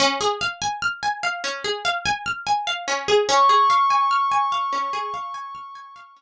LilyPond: <<
  \new Staff \with { instrumentName = "Pad 5 (bowed)" } { \time 4/4 \key des \major \tempo 4 = 73 r1 | des'''1 | }
  \new Staff \with { instrumentName = "Pizzicato Strings" } { \time 4/4 \key des \major des'16 aes'16 f''16 aes''16 f'''16 aes''16 f''16 des'16 aes'16 f''16 aes''16 f'''16 aes''16 f''16 des'16 aes'16 | des'16 aes'16 f''16 aes''16 f'''16 aes''16 f''16 des'16 aes'16 f''16 aes''16 f'''16 aes''16 f''16 des'16 r16 | }
>>